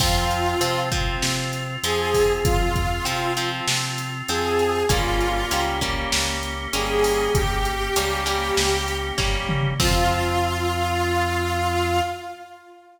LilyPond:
<<
  \new Staff \with { instrumentName = "Lead 2 (sawtooth)" } { \time 4/4 \key f \minor \tempo 4 = 98 f'4. r4. aes'4 | f'4. r4. aes'4 | f'4. r4. aes'4 | g'2. r4 |
f'1 | }
  \new Staff \with { instrumentName = "Overdriven Guitar" } { \time 4/4 \key f \minor <f c'>4 <f c'>8 <f c'>4. <f c'>4~ | <f c'>4 <f c'>8 <f c'>4. <f c'>4 | <g bes des'>4 <g bes des'>8 <g bes des'>4. <g bes des'>4~ | <g bes des'>4 <g bes des'>8 <g bes des'>4. <g bes des'>4 |
<f c'>1 | }
  \new Staff \with { instrumentName = "Drawbar Organ" } { \time 4/4 \key f \minor <c' f'>1~ | <c' f'>1 | <bes des' g'>1~ | <bes des' g'>1 |
<c' f'>1 | }
  \new Staff \with { instrumentName = "Synth Bass 1" } { \clef bass \time 4/4 \key f \minor f,4 c4 c4 f,4 | f,4 c4 c4 f,4 | g,,4 des,4 des,4 g,,4 | g,,4 des,4 des,4 g,,4 |
f,1 | }
  \new DrumStaff \with { instrumentName = "Drums" } \drummode { \time 4/4 <cymc bd>8 hh8 hh8 <hh bd>8 sn8 hh8 hh8 <hho bd>8 | <hh bd>8 <hh bd>8 hh8 hh8 sn8 hh8 hh8 hh8 | <hh bd>8 hh8 hh8 <hh bd>8 sn8 hh8 hh8 hho8 | <hh bd>8 hh8 hh8 hh8 sn8 hh8 <bd sn>8 toml8 |
<cymc bd>4 r4 r4 r4 | }
>>